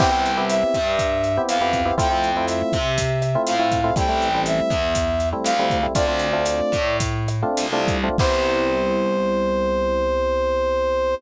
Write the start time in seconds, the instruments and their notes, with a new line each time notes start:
0.00 electric bass (finger) C2, electric piano 1 B3 C4 E4 G4, brass section G5, kick, cross-stick, crash
0.12 electric piano 1 B3 C4 E4 G4
0.26 closed hi-hat
0.37 electric piano 1 B3 C4 E4 G4
0.49 brass section E5, closed hi-hat
0.74 electric bass (finger) G2, kick, cross-stick, closed hi-hat
0.99 kick, closed hi-hat
1.24 closed hi-hat
1.37 electric piano 1 B3 C4 E4 G4
1.48 electric bass (finger) F2, brass section F5, cross-stick, closed hi-hat
1.61 electric piano 1 B3 C4 E4 G4
1.73 kick, closed hi-hat
1.85 electric piano 1 B3 C4 E4 G4
1.98 electric bass (finger) F2, electric piano 1 A3 C4 E4 F4, brass section G5, kick, closed hi-hat
2.10 electric piano 1 A3 C4 E4 F4
2.24 closed hi-hat
2.37 electric piano 1 A3 C4 E4 F4
2.48 brass section E5, cross-stick, closed hi-hat
2.73 electric bass (finger) C3, kick, closed hi-hat
2.98 kick, closed hi-hat
3.22 cross-stick, closed hi-hat
3.35 electric piano 1 A3 C4 E4 F4
3.47 electric bass (finger) A2, brass section F5, closed hi-hat
3.60 electric piano 1 A3 C4 E4 F4
3.72 kick, closed hi-hat
3.84 electric piano 1 A3 C4 E4 F4
3.96 electric bass (finger) A1, electric piano 1 G3 A3 C4 E4, brass section G5, kick, cross-stick, closed hi-hat
4.09 electric piano 1 G3 A3 C4 E4
4.22 closed hi-hat
4.34 electric piano 1 G3 A3 C4 E4
4.46 brass section E5, closed hi-hat
4.70 electric bass (finger) E2, kick, cross-stick, closed hi-hat
4.95 kick, closed hi-hat
5.20 closed hi-hat
5.33 electric piano 1 G3 A3 C4 E4
5.44 electric bass (finger) D2, brass section F5, cross-stick, closed hi-hat
5.59 electric piano 1 G3 A3 C4 E4
5.70 kick, closed hi-hat
5.83 electric piano 1 G3 A3 C4 E4
5.95 electric bass (finger) D2, electric piano 1 A3 C4 D4 F4, brass section D5, kick, closed hi-hat
6.08 electric piano 1 A3 C4 D4 F4
6.19 closed hi-hat
6.33 electric piano 1 A3 C4 D4 F4
6.45 cross-stick, closed hi-hat
6.72 electric bass (finger) A2, kick, closed hi-hat
7.00 kick, closed hi-hat
7.28 cross-stick, closed hi-hat
7.42 electric piano 1 A3 C4 D4 F4
7.57 electric bass (finger) C2, closed hi-hat
7.73 electric piano 1 A3 C4 D4 F4
7.88 kick, closed hi-hat
8.04 electric piano 1 A3 C4 D4 F4
8.18 electric bass (finger) C2, electric piano 1 B3 C4 E4 G4, brass section C5, kick, crash